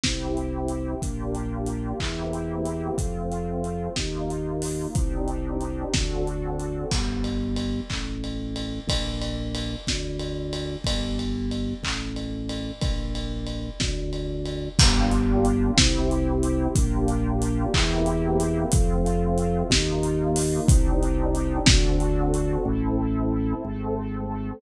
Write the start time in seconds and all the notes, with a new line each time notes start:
0.04 C2 C4 E4 G4, kick, snare
0.37 closed hi-hat
0.68 closed hi-hat
1.02 A#1 A#3 D4 F4 G4, kick, closed hi-hat
1.35 closed hi-hat
1.67 closed hi-hat
1.99 E2 A#3 C4 E4 G4, kick, clap
2.33 closed hi-hat
2.66 closed hi-hat
2.98 F2 A3 C4 F4, kick, closed hi-hat
3.32 closed hi-hat
3.64 closed hi-hat
3.96 D#2 A#3 D#4 F4, kick, snare
4.30 closed hi-hat
4.62 open hi-hat
4.95 C2 C4 D4 D#4 G4, kick, closed hi-hat
5.28 closed hi-hat
5.61 closed hi-hat
5.94 D2 C4 D4 F#4 A4, kick, snare
6.27 closed hi-hat
6.60 closed hi-hat
6.91 G1, kick, crash
7.24 ride
7.56 ride
7.90 A1, kick, clap
8.24 ride
8.56 ride
8.87 A#1, kick, ride
9.22 ride
9.55 ride
9.87 D2, kick, snare
10.20 ride
10.53 ride
10.84 G1, kick, ride
11.19 ride
11.52 ride
11.83 A1, kick, clap
12.16 ride
12.49 ride
12.81 A#1, kick, ride
13.15 ride
13.47 ride
13.80 D2, kick, snare
14.13 ride
14.46 ride
14.79 G1 A#3 D4 F4 G4, kick, crash
15.11 closed hi-hat
15.45 closed hi-hat
15.77 C2 C4 E4 G4, kick, snare
16.11 closed hi-hat
16.43 closed hi-hat
16.75 A#1 A#3 D4 F4 G4, kick, closed hi-hat
17.08 closed hi-hat
17.42 closed hi-hat
17.73 E2 A#3 C4 E4 G4, kick, clap
18.06 closed hi-hat
18.40 closed hi-hat
18.72 F2 A3 C4 F4, kick, closed hi-hat
19.06 closed hi-hat
19.38 closed hi-hat
19.70 D#2 A#3 D#4 F4, kick, snare
20.03 closed hi-hat
20.36 open hi-hat
20.68 C2 C4 D4 D#4 G4, kick, closed hi-hat
21.03 closed hi-hat
21.35 closed hi-hat
21.66 D2 C4 D4 F#4 A4, kick, snare
22.00 closed hi-hat
22.34 closed hi-hat
22.65 A1 C4 E4 A4
23.65 G#1 A3 C4 A4